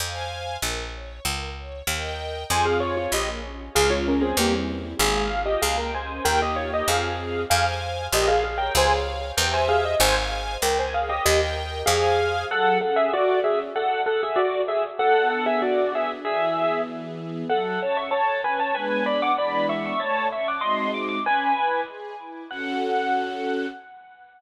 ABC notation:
X:1
M:2/4
L:1/16
Q:1/4=96
K:Fm
V:1 name="Acoustic Grand Piano"
z8 | z8 | [ca] [Af] [Fd] [Fd] [Ge] z3 | [Af] [Fd] [DB] [CA] [B,G] z3 |
[Af]3 [Ge] [Af] [Bg] [ca]2 | [Bg] [Ge] [Fd] [Ge] [Af]4 | [Af] z3 [Ge] [Af] [Af] [Bg] | [ca] z3 [Bg] [ca] [Af] e |
[ca] z3 [Bg] [ca] [Af] [Ge] | [Ge] z3 [Af]4 | [K:F#m] [Af]2 [Af] [Ge] [Fd]2 [Ge] z | [Af]2 [Af] [Ge] [Fd]2 [Ge] z |
[Af]2 [Af] [Ge] [Fd]2 [Ge] z | [Ge]4 z4 | [Af]2 [ca] [ec'] [ca]2 [Bg] [ca] | [Bg]2 [db] [fd'] [db]2 [ec'] [ec'] |
[ca]2 [ec'] [fd'] [^d^b]2 =d' d' | [Bg]4 z4 | f8 |]
V:2 name="String Ensemble 1"
[cfa]4 B2 d2 | B2 d2 [Beg]4 | [CFA]4 B,2 D2 | [A,DF]4 [G,C=E]4 |
A,2 F2 B,2 D2 | [B,EG]4 [CFA]4 | [cfa]4 B2 d2 | [Adf]4 [Gc=e]4 |
[cfa]4 B2 d2 | [Beg]4 [cfa]4 | [K:F#m] F,2 C2 A2 C2 | z8 |
B,2 D2 F2 D2 | E,2 B,2 G2 B,2 | F,2 C2 A2 C2 | [G,B,D]4 [E,G,B,D]4 |
A,2 C2 [G,^B,^DF]4 | C2 E2 G2 E2 | [CFA]8 |]
V:3 name="Electric Bass (finger)" clef=bass
F,,4 B,,,4 | D,,4 E,,4 | F,,4 B,,,4 | D,,4 =E,,4 |
A,,,4 D,,4 | E,,4 F,,4 | F,,4 B,,,4 | D,,4 =E,,4 |
A,,,4 D,,4 | E,,4 F,,4 | [K:F#m] z8 | z8 |
z8 | z8 | z8 | z8 |
z8 | z8 | z8 |]